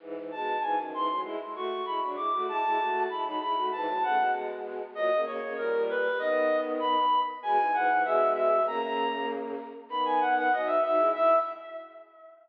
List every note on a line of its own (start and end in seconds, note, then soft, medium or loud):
0.00 0.14 G#2 medium
0.00 0.14 E3 medium
0.16 0.31 G#2 medium
0.16 0.31 E3 medium
0.31 0.57 B2 medium
0.31 0.57 G#3 medium
0.31 0.60 A5 medium
0.60 0.76 G#2 medium
0.60 0.76 E3 medium
0.60 0.75 G#5 medium
0.78 0.93 F#2 medium
0.78 0.93 D#3 medium
0.93 1.08 G#2 medium
0.93 1.08 E3 medium
0.93 1.20 C6 medium
1.09 1.24 A2 medium
1.09 1.24 F#3 medium
1.23 1.37 G#3 medium
1.23 1.37 E4 medium
1.39 1.54 G#3 medium
1.39 1.54 E4 medium
1.54 1.81 A3 medium
1.54 1.81 F#4 medium
1.54 1.85 C#6 medium
1.85 2.01 G#3 medium
1.85 2.01 E4 medium
1.85 2.00 B5 medium
2.01 2.16 F#3 medium
2.01 2.16 D4 medium
2.16 2.31 G#3 medium
2.16 2.31 E4 medium
2.16 2.42 D6 medium
2.32 2.46 A3 medium
2.32 2.46 F#4 medium
2.48 2.62 G#3 medium
2.48 2.62 E4 loud
2.48 3.00 A5 medium
2.63 2.78 G#3 medium
2.63 2.78 E4 medium
2.78 3.06 A3 medium
2.78 3.06 F#4 medium
3.08 3.23 G#3 medium
3.08 3.23 E4 medium
3.08 3.24 B5 medium
3.24 3.39 F#3 medium
3.24 3.39 D#4 medium
3.24 3.39 B5 medium
3.39 3.54 G#3 medium
3.39 3.54 E4 medium
3.39 3.65 B5 medium
3.56 3.71 A3 medium
3.56 3.71 F#4 medium
3.72 3.87 G#2 medium
3.72 3.87 E3 loud
3.72 4.01 A5 medium
3.87 4.02 A2 medium
3.87 4.02 F#3 medium
4.02 4.17 C#3 medium
4.02 4.17 A3 medium
4.02 4.31 F#5 medium
4.18 4.82 B2 medium
4.18 4.82 G#3 medium
4.95 5.10 A#2 medium
4.95 5.10 F#3 medium
4.95 5.21 D#5 loud
5.11 5.25 C#3 medium
5.11 5.25 A#3 medium
5.25 5.40 C#3 medium
5.25 5.40 A#3 medium
5.25 5.53 C#5 medium
5.41 5.55 C#3 medium
5.41 5.55 A#3 medium
5.57 6.08 A#2 medium
5.57 6.08 G3 medium
5.57 5.83 A#4 medium
5.89 6.19 B4 medium
6.18 6.95 D#3 medium
6.18 6.95 B3 loud
6.18 6.57 D#5 medium
6.79 7.19 B5 medium
7.43 7.57 B2 medium
7.43 7.57 G#3 loud
7.43 7.73 G#5 medium
7.59 7.72 G#2 medium
7.59 7.72 E3 medium
7.73 7.88 G#2 medium
7.73 7.88 E3 medium
7.73 8.02 F#5 medium
7.89 8.04 G#2 medium
7.89 8.04 E3 loud
8.04 8.60 B2 medium
8.04 8.60 G#3 loud
8.04 8.30 E5 medium
8.34 8.63 E5 medium
8.66 9.54 C#3 medium
8.66 9.54 A#3 loud
8.66 8.81 A#5 medium
8.82 9.26 A#5 medium
9.89 10.49 D#3 medium
9.89 10.49 B3 medium
9.89 10.04 B5 medium
10.05 10.20 G#5 medium
10.20 10.35 F#5 medium
10.37 10.52 F#5 medium
10.51 10.78 F#3 medium
10.51 10.78 D#4 medium
10.51 10.67 D#5 medium
10.66 10.80 E5 medium
10.82 10.98 F#3 medium
10.82 10.98 D#4 medium
10.82 11.08 E5 medium
10.97 11.12 G#3 medium
10.97 11.12 E4 loud
11.14 11.35 E4 loud
11.14 11.36 E5 loud